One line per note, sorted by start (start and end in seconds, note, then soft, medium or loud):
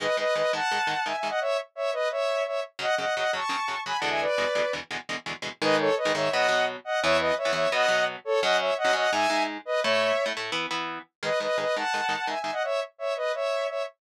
0.00 0.07 G#2 medium
0.00 0.07 D#3 medium
0.00 0.07 G#3 medium
0.00 0.16 B4 medium
0.00 0.16 D#5 medium
0.17 0.24 G#2 medium
0.17 0.24 D#3 medium
0.17 0.24 G#3 medium
0.17 0.34 B4 medium
0.17 0.34 D#5 medium
0.35 0.42 G#2 medium
0.35 0.42 D#3 medium
0.35 0.42 G#3 medium
0.35 0.52 B4 medium
0.35 0.52 D#5 medium
0.53 0.60 G#2 medium
0.53 0.60 D#3 medium
0.53 0.60 G#3 medium
0.53 1.04 F#5 medium
0.53 1.04 A5 medium
0.71 0.79 G#2 medium
0.71 0.79 D#3 medium
0.71 0.79 G#3 medium
0.87 0.94 G#2 medium
0.87 0.94 D#3 medium
0.87 0.94 G#3 medium
1.05 1.13 G#2 medium
1.05 1.13 D#3 medium
1.05 1.13 G#3 medium
1.05 1.16 E5 medium
1.05 1.16 G#5 medium
1.17 1.28 E5 medium
1.17 1.28 G#5 medium
1.23 1.30 G#2 medium
1.23 1.30 D#3 medium
1.23 1.30 G#3 medium
1.29 1.40 D#5 medium
1.29 1.40 F#5 medium
1.40 1.57 C#5 medium
1.40 1.57 E5 medium
1.75 1.91 C#5 medium
1.75 1.91 E5 medium
1.93 2.09 B4 medium
1.93 2.09 D#5 medium
2.11 2.43 C#5 medium
2.11 2.43 E5 medium
2.46 2.60 C#5 medium
2.46 2.60 E5 medium
2.79 2.86 F#2 medium
2.79 2.86 C#3 medium
2.79 2.86 F#3 medium
2.79 2.95 D#5 medium
2.79 2.95 F#5 medium
2.98 3.05 F#2 medium
2.98 3.05 C#3 medium
2.98 3.05 F#3 medium
2.98 3.15 D#5 medium
2.98 3.15 F#5 medium
3.16 3.24 F#2 medium
3.16 3.24 C#3 medium
3.16 3.24 F#3 medium
3.16 3.32 D#5 medium
3.16 3.32 F#5 medium
3.33 3.40 F#2 medium
3.33 3.40 C#3 medium
3.33 3.40 F#3 medium
3.33 3.80 A5 soft
3.33 3.80 C#6 medium
3.49 3.56 F#2 medium
3.49 3.56 C#3 medium
3.49 3.56 F#3 medium
3.68 3.75 F#2 medium
3.68 3.75 C#3 medium
3.68 3.75 F#3 medium
3.86 3.93 F#2 medium
3.86 3.93 C#3 medium
3.86 3.93 F#3 medium
3.86 3.97 G#5 medium
3.86 3.97 B5 medium
3.98 4.09 F#5 medium
3.98 4.09 A5 medium
4.02 4.26 E2 medium
4.02 4.26 B2 medium
4.02 4.26 D3 medium
4.02 4.26 G#3 medium
4.10 4.21 E5 medium
4.10 4.21 G#5 medium
4.21 4.72 B4 medium
4.21 4.72 D5 medium
4.38 4.45 E2 medium
4.38 4.45 B2 medium
4.38 4.45 D3 medium
4.38 4.45 G#3 medium
4.55 4.62 E2 medium
4.55 4.62 B2 medium
4.55 4.62 D3 medium
4.55 4.62 G#3 medium
4.73 4.80 E2 medium
4.73 4.80 B2 medium
4.73 4.80 D3 medium
4.73 4.80 G#3 medium
4.91 4.98 E2 medium
4.91 4.98 B2 medium
4.91 4.98 D3 medium
4.91 4.98 G#3 medium
5.09 5.16 E2 medium
5.09 5.16 B2 medium
5.09 5.16 D3 medium
5.09 5.16 G#3 medium
5.26 5.33 E2 medium
5.26 5.33 B2 medium
5.26 5.33 D3 medium
5.26 5.33 G#3 medium
5.42 5.49 E2 medium
5.42 5.49 B2 medium
5.42 5.49 D3 medium
5.42 5.49 G#3 medium
5.62 5.90 G#2 loud
5.62 5.90 D#3 loud
5.62 5.90 G#3 loud
5.62 5.76 B4 medium
5.62 5.76 D#5 medium
5.79 5.95 A4 medium
5.79 5.95 C#5 medium
5.97 6.12 B4 medium
5.97 6.12 D#5 medium
6.05 6.12 G#2 medium
6.05 6.12 D#3 medium
6.05 6.12 G#3 medium
6.14 6.29 G#2 medium
6.14 6.29 D#3 medium
6.14 6.29 G#3 medium
6.14 6.30 C#5 medium
6.14 6.30 E5 medium
6.31 6.47 B2 loud
6.31 6.47 F#3 loud
6.31 6.47 B3 loud
6.31 6.65 D#5 medium
6.31 6.65 F#5 medium
6.48 6.77 B2 medium
6.48 6.77 F#3 medium
6.48 6.77 B3 medium
6.84 7.00 D#5 medium
6.84 7.00 F#5 medium
7.02 7.32 E2 loud
7.02 7.32 E3 loud
7.02 7.32 B3 loud
7.02 7.17 C#5 medium
7.02 7.17 E5 medium
7.20 7.34 B4 medium
7.20 7.34 D#5 medium
7.37 7.52 C#5 medium
7.37 7.52 E5 medium
7.45 7.52 E2 medium
7.45 7.52 E3 loud
7.45 7.52 B3 medium
7.53 7.67 E2 medium
7.53 7.67 E3 medium
7.53 7.67 B3 medium
7.53 7.69 C#5 medium
7.53 7.69 E5 medium
7.72 7.86 B2 loud
7.72 7.86 F#3 medium
7.72 7.86 B3 loud
7.72 8.05 D#5 medium
7.72 8.05 F#5 medium
7.88 8.16 B2 medium
7.88 8.16 F#3 medium
7.88 8.16 B3 medium
8.25 8.40 A4 medium
8.25 8.40 C#5 medium
8.42 8.71 F#2 loud
8.42 8.71 F#3 medium
8.42 8.71 C#4 loud
8.42 8.57 D#5 medium
8.42 8.57 F#5 medium
8.60 8.74 C#5 medium
8.60 8.74 E5 medium
8.77 8.94 D#5 medium
8.77 8.94 F#5 medium
8.85 8.92 F#2 medium
8.85 8.92 F#3 medium
8.85 8.92 C#4 medium
8.93 9.07 F#2 medium
8.93 9.07 F#3 medium
8.93 9.07 C#4 medium
8.93 9.11 D#5 medium
8.93 9.11 F#5 medium
9.12 9.27 G#2 loud
9.12 9.27 G#3 medium
9.12 9.27 D#4 medium
9.12 9.43 E5 medium
9.12 9.43 G#5 medium
9.30 9.58 G#2 medium
9.30 9.58 G#3 medium
9.30 9.58 D#4 medium
9.65 9.80 B4 medium
9.65 9.80 D#5 medium
9.82 10.12 A2 loud
9.82 10.12 A3 loud
9.82 10.12 E4 loud
9.82 10.25 C#5 medium
9.82 10.25 E5 medium
10.26 10.33 A2 medium
10.26 10.33 A3 medium
10.26 10.33 E4 medium
10.37 10.51 A2 medium
10.37 10.51 A3 medium
10.37 10.51 E4 medium
10.52 10.66 E3 loud
10.52 10.66 B3 loud
10.52 10.66 E4 loud
10.71 10.99 E3 medium
10.71 10.99 B3 medium
10.71 10.99 E4 medium
11.23 11.30 G#2 medium
11.23 11.30 D#3 medium
11.23 11.30 G#3 medium
11.23 11.39 B4 medium
11.23 11.39 D#5 medium
11.40 11.47 G#2 medium
11.40 11.47 D#3 medium
11.40 11.47 G#3 medium
11.40 11.57 B4 medium
11.40 11.57 D#5 medium
11.58 11.65 G#2 medium
11.58 11.65 D#3 medium
11.58 11.65 G#3 medium
11.58 11.75 B4 medium
11.58 11.75 D#5 medium
11.76 11.83 G#2 medium
11.76 11.83 D#3 medium
11.76 11.83 G#3 medium
11.76 12.27 F#5 medium
11.76 12.27 A5 medium
11.94 12.01 G#2 medium
11.94 12.01 D#3 medium
11.94 12.01 G#3 medium
12.09 12.16 G#2 medium
12.09 12.16 D#3 medium
12.09 12.16 G#3 medium
12.27 12.34 G#2 medium
12.27 12.34 D#3 medium
12.27 12.34 G#3 medium
12.27 12.39 E5 soft
12.27 12.39 G#5 medium
12.40 12.51 E5 medium
12.40 12.51 G#5 medium
12.44 12.51 G#2 medium
12.44 12.51 D#3 soft
12.44 12.51 G#3 medium
12.52 12.63 D#5 medium
12.52 12.63 F#5 medium
12.63 12.80 C#5 medium
12.63 12.80 E5 medium
12.98 13.14 C#5 medium
12.98 13.14 E5 medium
13.16 13.32 B4 medium
13.16 13.32 D#5 medium
13.34 13.67 C#5 medium
13.34 13.67 E5 medium
13.68 13.83 C#5 soft
13.68 13.83 E5 medium